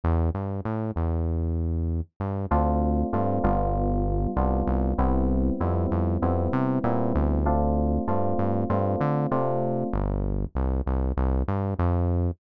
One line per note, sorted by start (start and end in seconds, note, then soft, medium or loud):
0.04 0.30 E2 medium
0.34 0.61 G2 medium
0.65 0.91 A2 medium
0.96 2.01 E2 medium
2.20 2.46 G2 medium
2.51 3.03 D2 medium
2.51 3.07 A3 loud
2.51 3.07 C4 medium
2.51 3.07 D4 loud
2.51 3.07 F4 loud
3.13 3.39 G2 medium
3.13 3.42 A3 medium
3.13 3.42 C4 medium
3.13 3.42 D4 medium
3.13 3.42 F4 medium
3.44 4.27 G1 medium
3.44 4.30 G3 loud
3.44 4.30 B3 loud
3.44 4.30 D4 medium
3.44 4.30 F4 loud
4.36 4.63 C2 medium
4.36 4.92 G3 medium
4.36 4.92 B3 medium
4.36 4.92 D4 medium
4.36 4.92 F4 medium
4.67 4.93 C2 medium
4.98 5.51 C2 medium
4.98 5.54 G3 loud
4.98 5.54 B3 loud
4.98 5.54 C4 loud
4.98 5.54 E4 medium
5.60 5.86 F2 medium
5.60 6.16 G3 loud
5.60 6.16 B3 medium
5.60 6.16 C4 medium
5.60 6.16 E4 medium
5.91 6.18 F2 medium
6.22 6.48 F2 medium
6.22 6.78 G3 medium
6.22 6.78 B3 medium
6.22 6.78 C4 medium
6.22 6.78 E4 medium
6.53 6.79 C3 medium
6.84 7.13 A#2 medium
6.84 7.40 G3 medium
6.84 7.40 B3 medium
6.84 7.40 C4 medium
6.84 7.40 E4 medium
7.15 7.98 D2 medium
7.46 8.01 A3 loud
7.46 8.01 C4 loud
7.46 8.01 D4 loud
7.46 8.01 F4 loud
8.08 8.34 G2 medium
8.08 8.63 A3 medium
8.08 8.63 C4 medium
8.08 8.63 D4 medium
8.08 8.63 F4 medium
8.38 8.65 G2 medium
8.70 8.96 G2 medium
8.70 9.25 A3 medium
8.70 9.25 C4 medium
8.70 9.25 D4 medium
8.70 9.25 F4 medium
9.01 9.27 D3 medium
9.31 9.84 C3 medium
9.31 9.87 A3 medium
9.31 9.87 C4 medium
9.31 9.87 D4 medium
9.31 9.87 F4 medium
9.93 10.46 G1 medium
10.55 10.81 C2 medium
10.86 11.13 C2 medium
11.17 11.43 C2 medium
11.48 11.74 G2 medium
11.79 12.31 F2 medium